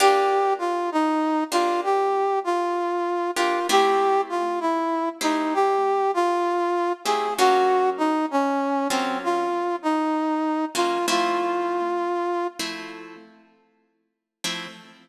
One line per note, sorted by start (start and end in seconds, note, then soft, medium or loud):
0.00 0.73 A#3 loud
0.00 0.73 D4 loud
0.00 0.73 F4 loud
0.00 0.53 G4 loud
0.00 0.73 G4 loud
0.59 0.90 F4 loud
0.92 1.44 D#4 loud
1.51 2.08 A#3 medium
1.51 2.08 D4 medium
1.51 1.81 F4 loud
1.51 2.08 F4 medium
1.51 2.08 G4 medium
1.84 2.39 G4 loud
2.44 3.31 F4 loud
3.36 3.59 A#3 medium
3.36 3.59 D4 medium
3.36 3.67 F4 loud
3.36 3.59 F4 medium
3.36 3.59 G4 medium
3.69 4.42 A3 loud
3.69 4.42 C4 loud
3.69 4.42 E4 loud
3.69 4.42 G4 medium
3.69 4.21 G4 loud
4.29 4.59 F4 loud
4.60 5.09 E4 loud
5.21 5.78 A3 medium
5.21 5.78 C4 medium
5.21 5.54 D#4 medium
5.21 5.78 E4 medium
5.21 5.78 G4 medium
5.54 6.11 G4 loud
6.14 6.93 F4 loud
7.04 7.28 A3 medium
7.04 7.28 C4 medium
7.04 7.28 E4 medium
7.04 7.28 G4 medium
7.04 7.34 G#4 medium
7.38 8.11 F#3 medium
7.38 8.11 A#3 loud
7.38 8.11 C#4 loud
7.38 8.11 F4 medium
7.38 7.90 F#4 loud
7.98 8.26 D#4 loud
8.31 8.88 C#4 loud
8.89 9.47 F#3 medium
8.89 9.47 A#3 medium
8.89 9.18 C4 loud
8.89 9.47 C#4 medium
8.89 9.47 F4 medium
9.24 9.76 F4 loud
9.83 10.65 D#4 loud
10.75 10.98 F#3 medium
10.75 10.98 A#3 medium
10.75 10.98 C#4 medium
10.75 10.98 F4 medium
10.75 11.06 F4 loud
11.08 11.80 F3 loud
11.08 11.80 A3 loud
11.08 11.80 C4 loud
11.08 11.80 E4 loud
11.08 12.47 F4 loud
12.59 13.16 F3 medium
12.59 13.16 A3 medium
12.59 13.16 C4 medium
12.59 13.16 E4 medium
14.44 14.67 F3 medium
14.44 14.67 A3 medium
14.44 14.67 C4 medium
14.44 14.67 E4 medium